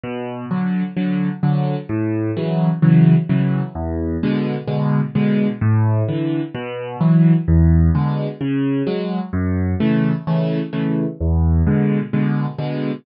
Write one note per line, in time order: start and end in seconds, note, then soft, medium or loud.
0.03 0.45 B2 medium
0.51 0.83 D3 medium
0.51 0.83 F#3 medium
0.97 1.29 D3 medium
0.97 1.29 F#3 medium
1.43 1.75 D3 medium
1.43 1.75 F#3 medium
1.89 2.31 A2 loud
2.37 2.69 C#3 medium
2.37 2.69 E3 medium
2.37 2.69 F#3 medium
2.82 3.15 C#3 medium
2.82 3.15 E3 medium
2.82 3.15 F#3 medium
3.29 3.62 C#3 medium
3.29 3.62 E3 medium
3.29 3.62 F#3 medium
3.75 4.17 E2 loud
4.23 4.56 B2 medium
4.23 4.56 D3 medium
4.23 4.56 G#3 medium
4.67 5.00 B2 medium
4.67 5.00 D3 medium
4.67 5.00 G#3 medium
5.15 5.48 B2 medium
5.15 5.48 D3 medium
5.15 5.48 G#3 medium
5.61 6.03 A2 loud
6.08 6.41 D3 medium
6.08 6.41 E3 medium
6.55 6.96 B2 loud
7.01 7.33 E3 medium
7.01 7.33 F#3 medium
7.48 7.90 E2 loud
7.95 8.27 B2 medium
7.95 8.27 D3 medium
7.95 8.27 G#3 medium
8.41 8.83 C#3 medium
8.87 9.19 F#3 medium
8.87 9.19 G#3 medium
9.33 9.75 F#2 loud
9.80 10.13 C#3 medium
9.80 10.13 E3 medium
9.80 10.13 A3 medium
10.27 10.60 C#3 medium
10.27 10.60 E3 medium
10.27 10.60 A3 medium
10.73 11.05 C#3 medium
10.73 11.05 E3 medium
10.73 11.05 A3 medium
11.21 11.62 E2 medium
11.67 11.99 B2 medium
11.67 11.99 D3 medium
11.67 11.99 G#3 medium
12.13 12.46 B2 medium
12.13 12.46 D3 medium
12.13 12.46 G#3 medium
12.58 12.91 B2 medium
12.58 12.91 D3 medium
12.58 12.91 G#3 medium